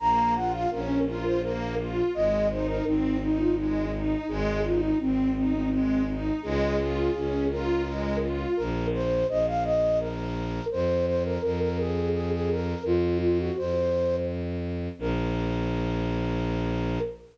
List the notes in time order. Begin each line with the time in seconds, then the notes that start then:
0.00 A#1 A#3 A#5
0.35 F4 F#5
0.53 F5
0.71 A#1 C#4 A#4
1.07 F4 A#4
1.25 C5
1.43 A#3 A#4
1.78 F4
2.14 G#1 G#3 D#5
2.50 D#4 C5
2.68 A#4
2.84 G#1 C4 D#4
3.21 D#4
3.39 F4
3.56 G#3 D#4
3.94 D#4
4.28 G#1 G#3 G#4
4.64 D#4 F4
4.82 D#4
5.00 G#1 C4
5.36 C4 D#4
5.54 C4
5.71 G#3 C4
6.08 D#4
6.43 C#2 G#3 G#4
6.78 F4
7.14 C#2 C#4
7.50 F4 A#4
7.86 G#3
8.22 F4
8.57 A#1 A#4
8.94 C5
9.29 A#1 D#5
9.47 F5
9.64 D#5
10.00 A#4
10.72 F2 C5
11.07 C5
11.25 A#4
11.43 F2 A#4
11.61 A#4
11.78 G#4
12.14 G#4
12.32 G#4
12.50 A#4
12.84 F2 F4
13.21 F4
13.39 F#4
13.57 F2 C5
14.99 A#1 A#4